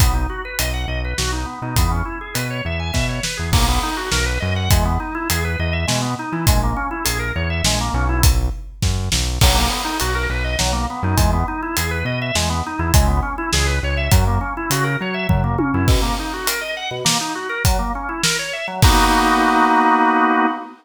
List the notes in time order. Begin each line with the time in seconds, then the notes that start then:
0.00 B1 B3, kick, closed hi-hat
0.14 D#4
0.30 F#4
0.45 B4
0.59 B1 D#5, closed hi-hat
0.73 F#5
0.88 B1 D#5
1.05 B4
1.18 B1 F#4, snare
1.32 D#4
1.46 B3
1.62 B2 D#4
1.76 E2 B3, kick, closed hi-hat
1.91 C#4
2.05 E4
2.21 G#4
2.34 B2 B4, closed hi-hat
2.50 C#5
2.65 E2 E5
2.80 G#5
2.93 B2 E5, kick, snare
3.09 C#5
3.23 B4, snare
3.37 E2 G#4
3.52 B1 A#3, kick, crash
3.69 B3
3.83 D#4
3.97 F#4
4.12 B1 A#4, snare
4.26 B4
4.40 F#2 D#5
4.56 F#5
4.70 E2 G#3, kick, closed hi-hat
4.85 B3
5.00 D#4
5.15 E4
5.30 E2 G#4, closed hi-hat
5.44 B4
5.59 E2 D#5
5.73 E5
5.87 B2 G#3, snare
6.01 B3
6.19 D#4
6.32 E3 E4
6.47 A#1 G#3, kick, closed hi-hat
6.63 A#3
6.76 C#4
6.91 E4
7.05 A#1 G#4, closed hi-hat
7.19 A#4
7.36 E2 C#5
7.50 E5
7.64 A#1 G#3, snare
7.80 A#3
7.94 B1 C#4
8.09 E4
8.23 kick, closed hi-hat
8.82 F#2, kick, snare
9.12 B1, snare
9.41 B1 F#3, kick, crash
9.54 A#3
9.69 B3
9.85 D#4
10.00 B1 F#4, closed hi-hat
10.15 A#4
10.30 B1 B4
10.44 D#5
10.59 B1 F#3, snare
10.73 A#3
10.90 B3
11.03 F#2 D#4
11.17 E2 G#3, kick, closed hi-hat
11.33 B3
11.48 D#4
11.62 E4
11.77 E2 G#4, closed hi-hat
11.91 B4
12.05 B2 D#5
12.22 E5
12.35 E2 G#3, snare
12.50 B3
12.66 D#4
12.79 E2 E4
12.94 C#2 G#3, kick, closed hi-hat
13.07 B3
13.22 C#4
13.38 E4
13.53 C#2 G#4, snare
13.66 B4
13.83 C#2 C#5
13.97 E5
14.11 F#2 F#3, kick, closed hi-hat
14.27 A#3
14.41 C#4
14.57 E4
14.70 C#3 F#4, closed hi-hat
14.84 A#4
15.01 F#3 C#5
15.14 E5
15.29 F#2 F#3, kick, floor tom
15.44 A#3
15.58 C#4, high tom
15.74 F#2 E4
15.88 B2, kick, crash
16.02 A#3
16.19 D#4
16.33 F#4
16.47 A#4, closed hi-hat
16.61 D#5
16.77 F#5
16.91 B2
17.05 A#3, snare
17.21 D#4
17.35 F#4
17.49 A#4
17.65 F#3, kick, closed hi-hat
17.79 A#3
17.95 C#4
18.09 E4
18.24 A#4, snare
18.39 C#5
18.53 E5
18.68 F#3
18.82 A#3 B3 D#4 F#4, kick, crash